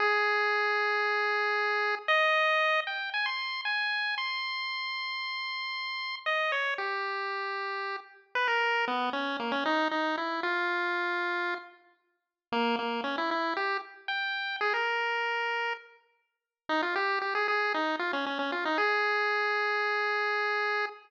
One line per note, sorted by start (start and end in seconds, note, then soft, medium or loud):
0.00 1.95 G#4 loud
2.08 2.80 D#5 loud
2.87 3.10 G5 medium
3.14 3.26 G#5 medium
3.26 3.61 C6 medium
3.65 4.15 G#5 medium
4.18 6.16 C6 medium
6.26 6.52 D#5 medium
6.52 6.74 C#5 medium
6.78 7.96 G4 medium
8.35 8.48 B4 loud
8.48 8.85 A#4 medium
8.87 9.10 B3 medium
9.13 9.37 C#4 medium
9.39 9.52 A#3 medium
9.52 9.64 C#4 medium
9.66 9.88 D#4 medium
9.91 10.16 D#4 medium
10.17 10.41 E4 medium
10.43 11.54 F4 medium
12.52 12.76 A#3 loud
12.79 13.01 A#3 medium
13.04 13.16 C#4 medium
13.18 13.30 E4 medium
13.31 13.54 E4 medium
13.57 13.77 G4 medium
14.08 14.56 G5 medium
14.61 14.73 G#4 medium
14.74 15.73 A#4 medium
16.69 16.82 D#4 medium
16.82 16.95 F4 medium
16.96 17.19 G4 medium
17.22 17.34 G4 medium
17.35 17.47 G#4 medium
17.48 17.73 G#4 medium
17.74 17.96 D#4 medium
17.99 18.12 F4 medium
18.13 18.25 C#4 medium
18.26 18.38 C#4 medium
18.39 18.51 C#4 medium
18.52 18.65 F4 medium
18.65 18.78 D#4 medium
18.78 20.86 G#4 loud